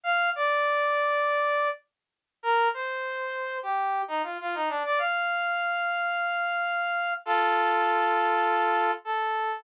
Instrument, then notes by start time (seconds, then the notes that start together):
brass section
0.04 F5
0.35 D5
2.43 A#4
2.74 C5
3.63 G4
4.08 D#4
4.23 F4
4.41 F4
4.55 D#4
4.69 D4
4.85 D5
4.99 F5
7.25 F4 A4
9.05 A4